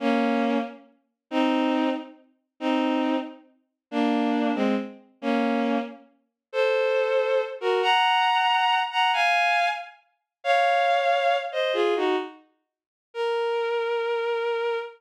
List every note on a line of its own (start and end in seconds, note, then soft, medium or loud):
0.00 0.58 A#3 loud
0.00 0.58 C#4 loud
1.31 1.90 C4 loud
1.31 1.90 D#4 loud
2.60 3.16 C4 loud
2.60 3.16 D#4 loud
3.91 4.51 A#3 loud
3.91 4.51 D4 loud
4.55 4.75 G#3 loud
4.55 4.75 C4 loud
5.22 5.78 A#3 loud
5.22 5.78 C#4 loud
6.53 7.41 A4 loud
6.53 7.41 C5 loud
7.61 7.82 F#4 medium
7.61 7.82 A#4 loud
7.82 8.79 F#5 medium
7.82 8.79 A#5 loud
8.92 9.11 F#5 medium
8.92 9.11 A#5 medium
9.13 9.68 F5 loud
9.13 9.68 G#5 loud
10.44 11.37 C#5 loud
10.44 11.37 F5 loud
11.52 11.73 C5 medium
11.52 11.73 D#5 medium
11.73 11.94 F4 loud
11.73 11.94 G#4 loud
11.96 12.16 D#4 medium
11.96 12.16 F#4 loud
13.14 14.78 A#4 loud